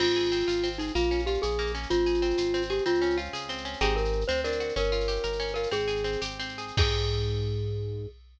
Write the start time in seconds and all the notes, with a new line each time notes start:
0.00 G#1 C4 F4, crash
0.07 shaker
0.16 G#4, shaker
0.24 shaker
0.31 C4, shaker
0.40 shaker
0.48 G#1 F4, shaker
0.56 shaker
0.63 C4, shaker
0.72 shaker
0.78 D#4 G#4, shaker
0.87 shaker
0.95 A#1 A#3 F4, shaker
1.03 shaker
1.11 C#4, shaker
1.19 shaker
1.26 F4 G4, shaker
1.34 shaker
1.42 A#1 G#4, shaker
1.51 shaker
1.59 A#3, shaker
1.67 shaker
1.75 C#4, shaker
1.83 shaker
1.90 G#1 C4 F4, shaker
1.99 shaker
2.06 G#4, shaker
2.14 shaker
2.22 C4, shaker
2.30 shaker
2.37 G#1 F4, shaker
2.45 shaker
2.54 C4, shaker
2.62 shaker
2.70 G4 G#4, shaker
2.78 shaker
2.85 C#2 C4 F4, shaker
2.94 shaker
3.02 C#4, shaker
3.10 shaker
3.17 F4, shaker
3.25 shaker
3.33 C#2 G#4, shaker
3.41 shaker
3.49 C4, shaker
3.57 shaker
3.65 C#4, shaker
3.73 shaker
3.81 G#1 C4 D#4 G4 G#4, shaker
3.89 shaker
3.96 A#4, shaker
4.05 shaker
4.13 shaker
4.21 shaker
4.28 D2 C4 C5, shaker
4.37 shaker
4.44 D4 A#4, shaker
4.52 shaker
4.60 F#4, shaker
4.69 shaker
4.76 G1 C#4 A#4, shaker
4.83 shaker
4.92 F4, shaker
5.00 shaker
5.08 G4, shaker
5.16 shaker
5.23 G1 A#4, shaker
5.32 shaker
5.40 C#4, shaker
5.47 shaker
5.54 F4 A#4, shaker
5.63 shaker
5.71 G#1 C4 G#4, shaker
5.80 shaker
5.87 G#4, shaker
5.96 shaker
6.04 C4, shaker
6.12 shaker
6.21 G#1 G4, shaker
6.30 shaker
6.39 C4, shaker
6.49 shaker
6.58 G#4, shaker
6.68 shaker
6.77 G#2 C4 D#4 G4 G#4, kick, crash